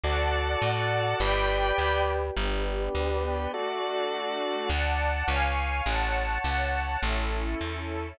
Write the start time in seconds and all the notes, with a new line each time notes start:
0.04 D2 F#4 A4 D5 F#5 A5
0.62 A2
1.20 G1 G4 B4 D5 G5 B5
1.78 D2
2.36 G1 B3 D4 G4 B4 D5
2.95 D2
3.53 A3 D4 F#4 A4 D5
4.70 D2 D5 F#5 A5
5.28 C#2 C#5 F5 G#5
5.85 A1 C#5 F#5 A5
6.44 C#2
7.02 A1 C#4 E4 A4
7.61 E2